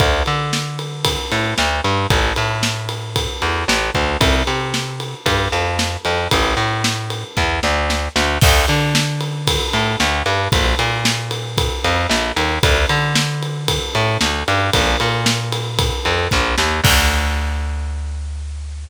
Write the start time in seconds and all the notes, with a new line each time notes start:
0.00 D2, kick, ride
0.26 D3, ride
0.53 snare
0.79 ride
1.05 kick, ride
1.32 A2, ride
1.58 D2, snare
1.84 G2, ride
2.10 A1, kick, ride
2.36 A2, ride
2.63 snare
2.89 ride
3.16 kick, ride
3.42 E2, ride
3.68 A1, snare
3.95 D2, kick, ride
4.21 C2, kick, ride
4.47 C3, ride
4.74 snare
5.00 ride
5.26 G2, kick, ride
5.52 F2, ride
5.79 snare
6.05 F2, ride
6.31 A1, kick, ride
6.57 A2, ride
6.84 snare
7.10 ride
7.37 E2, kick, snare
7.63 D2, snare
7.90 snare
8.16 D2, snare
8.41 D2, kick, crash
8.68 D3, ride
8.95 snare
9.21 ride
9.47 kick, ride
9.73 A2, ride
10.00 D2, snare
10.26 G2, ride
10.52 A#1, kick, ride
10.79 A#2, ride
11.05 snare
11.31 ride
11.58 kick, ride
11.84 F2, ride
12.09 A#1, snare
12.36 D#2, ride
12.63 D2, kick, ride
12.89 D3, ride
13.15 snare
13.43 ride
13.68 kick, ride
13.95 A2, ride
14.21 D2, snare
14.48 G2, ride
14.73 A#1, kick, ride
15.00 A#2, ride
15.26 snare
15.52 ride
15.79 kick, ride
16.05 F2, ride
16.31 A#1, kick, snare
16.58 D#2, snare
16.84 D2, kick, crash